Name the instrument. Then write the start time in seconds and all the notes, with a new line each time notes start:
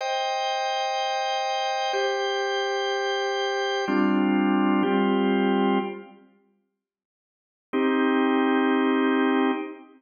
drawbar organ
0.01 C5 D#5 G5
1.93 G4 C5 G5
3.88 G3 C4 D4 F4
4.83 G3 C4 F4 G4
7.73 C4 D#4 G4